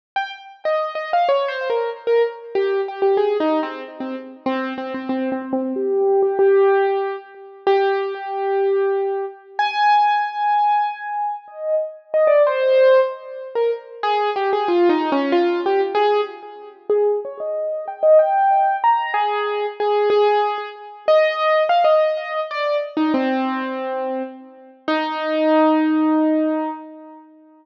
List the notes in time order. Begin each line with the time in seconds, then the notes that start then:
0.16 G5
0.65 D#5
0.95 D#5
1.13 F5
1.29 C#5
1.48 C5
1.70 A#4
2.07 A#4
2.55 G4
2.88 G4
3.02 G4
3.17 G#4
3.40 D#4
3.63 C4
4.00 C4
4.46 C4
4.78 C4
4.94 C4
5.09 C4
5.32 C4
5.53 C4
5.76 G4
6.22 G4
6.39 G4
7.67 G4
9.59 G#5
11.48 D#5
12.14 D#5
12.27 D5
12.47 C5
13.55 A#4
14.03 G#4
14.36 G4
14.53 G#4
14.68 F4
14.89 D#4
15.12 C#4
15.32 F4
15.66 G4
15.95 G#4
16.89 G#4
17.25 C#5
17.40 D#5
17.88 G5
18.03 D#5
18.19 G5
18.84 A#5
19.14 G#4
19.80 G#4
20.10 G#4
21.08 D#5
21.69 F5
21.84 D#5
22.51 D5
22.97 D#4
23.14 C4
24.88 D#4